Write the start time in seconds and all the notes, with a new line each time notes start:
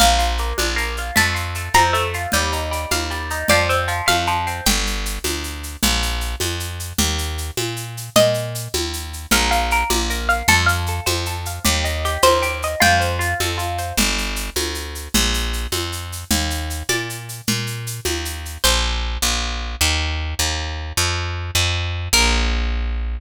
0.00 A#1 A#3 F5, low conga, shaker
0.19 F4, shaker
0.38 A#3, shaker
0.58 A#1 D4, high conga, shaker
0.76 A#3, shaker
0.97 F4, shaker
1.16 F2 A3 A5, low conga, shaker
1.35 F4, shaker
1.55 A3, shaker
1.74 F2 C4 A#5, high conga, shaker
1.93 A3, shaker
2.14 F4, shaker
2.32 D#2 G3, low conga, shaker
2.52 D#4, shaker
2.71 G3, shaker
2.91 D#2 A#3 F5, high conga, shaker
3.11 G3, shaker
3.30 D#4, shaker
3.48 F2 F3 D5, low conga, shaker
3.69 C4, shaker
3.88 F3, shaker
4.06 F2 A3 F5, high conga, shaker
4.27 F3, shaker
4.47 C4, shaker
4.66 G1 G5, low conga, shaker
4.86 shaker
5.06 shaker
5.24 D2, high conga, shaker
5.44 shaker
5.63 shaker
5.83 A#1, low conga, shaker
6.02 shaker
6.21 shaker
6.40 F2, high conga, shaker
6.60 shaker
6.80 shaker
6.98 D#2, low conga, shaker
7.18 shaker
7.38 shaker
7.57 A#2, high conga, shaker
7.76 shaker
7.97 shaker
8.16 A#2 D#5, low conga, shaker
8.34 shaker
8.55 shaker
8.73 D#2, high conga, shaker
8.93 shaker
9.13 shaker
9.31 A#1 A#4, low conga, shaker
9.51 F5, shaker
9.71 A#4, shaker
9.90 A#1 D5, high conga, shaker
10.10 A#4, shaker
10.29 F5, shaker
10.48 F2 A4, low conga, shaker
10.66 F5, shaker
10.86 A4, shaker
11.06 F2 C5, high conga, shaker
11.26 A4, shaker
11.45 F5, shaker
11.64 D#2 G4, low conga, shaker
11.84 D#5, shaker
12.05 G4, shaker
12.22 D#2 A#4 C5, high conga, shaker
12.42 G4, shaker
12.62 D#5, shaker
12.80 F2 F4 G5, low conga, shaker
13.00 C5, shaker
13.19 F4, shaker
13.40 F2 A4, high conga, shaker
13.58 F4, shaker
13.78 C5, shaker
13.97 G1, low conga, shaker
14.18 shaker
14.36 shaker
14.56 D2, high conga, shaker
14.75 shaker
14.95 shaker
15.14 A#1, low conga, shaker
15.34 shaker
15.53 shaker
15.72 F2, high conga, shaker
15.92 shaker
16.12 shaker
16.31 D#2, low conga, shaker
16.50 shaker
16.70 shaker
16.89 A#2 D5, high conga, shaker
17.10 shaker
17.29 shaker
17.47 A#2, low conga, shaker
17.67 shaker
17.87 shaker
18.05 D#2, high conga, shaker
18.25 shaker
18.45 shaker
18.64 A#1 C5
19.22 A#1
19.81 D#2
20.39 D#2
20.97 F2
21.55 F2
22.13 A#1 A#4